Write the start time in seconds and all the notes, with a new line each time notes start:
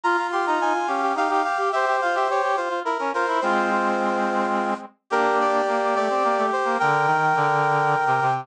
0.04 F4 A#5
0.17 F4
0.32 G4 C6
0.46 D#4 A#5
0.60 D#4 G#5
0.74 F4
0.87 C#4 G4 F5
1.02 G4
1.15 D#4 G4 F5
1.29 D#4 G4 F5
1.44 G4 F5
1.59 G4
1.72 G4 C5 E5
1.87 G4
2.01 F4 F5
2.14 G4 E5
2.28 G4 C#5
2.43 G4
2.57 F4 C5
2.69 F4
2.84 E4 A#4
2.98 C#4 A#4
3.13 F4 A#4 C5
3.27 E4
3.41 G#3 C4 F4 C5
3.71 F4
5.10 A#3 D4 G4 A#4
5.40 D5
5.67 A#3
5.95 A3 D5
6.10 C4
6.24 A#3
6.38 A3
6.52 C5
6.65 A#3
6.79 D3 A#4 G5
7.06 D#3
7.36 D3
8.06 C3
8.21 C3